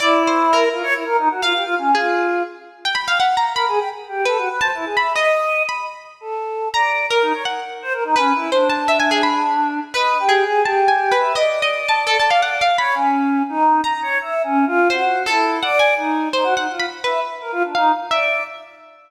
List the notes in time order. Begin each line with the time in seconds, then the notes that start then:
0.00 E4 D5
0.27 C5
0.53 A#4
0.71 F4
0.83 C#5
0.94 E4
1.06 A#4
1.18 D#4
1.30 F#4
1.42 F4 F5
1.54 G4
1.64 F4
1.78 C#4
1.95 F4 G#4
2.85 G5
2.95 B5
3.08 F5
3.20 F#5
3.37 A#5
3.54 A#4 B5
3.68 G#4
3.78 G5
4.09 G4
4.25 A4 B4
4.38 F#4
4.49 B4
4.60 C5 A5
4.74 E4
4.85 G#4
4.97 E5 B5
5.15 D#5
5.69 B5
6.21 A4
6.74 D5 A#5
7.11 A#4
7.22 D#4
7.33 C#5
7.45 F#5
7.82 C5
7.93 A#4
8.04 D#4
8.16 C#4 B4
8.34 E4
8.52 D4 C5
8.70 A5
8.88 E5
9.00 G#5
9.11 G#4
9.23 B5
9.94 B4 D#5
10.20 G4
10.29 G#4
10.46 G#4
10.65 G4 A5
10.88 G#5
11.12 B4
11.19 E5
11.35 D5 D#5
11.62 D#5
11.89 A5
12.07 A4
12.20 A5
12.30 F5
12.42 F#5
12.61 F5
12.78 C#5 B5
12.95 C#4
13.49 D#4
13.84 A#5
14.02 C#5
14.21 E5
14.44 C#4
14.67 F4
14.90 F#4 C5
15.26 E4 A4
15.62 D5 F#5
15.79 G#5
15.97 D#4
16.33 D#4 C5
16.44 F#4
16.56 D#4 F#5
16.70 F4
16.80 B5
17.04 B4 E5
17.41 A#4
17.52 F4
17.64 D4
17.75 D#4 F5
18.11 D5 E5